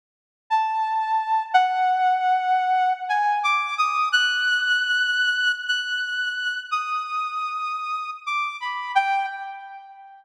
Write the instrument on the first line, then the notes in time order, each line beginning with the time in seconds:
lead 2 (sawtooth)
0.50 A5
1.53 F#5
3.09 G#5
3.43 D6
3.78 D#6
4.12 F#6
5.67 F#6
6.71 D#6
8.26 D6
8.60 B5
8.95 G5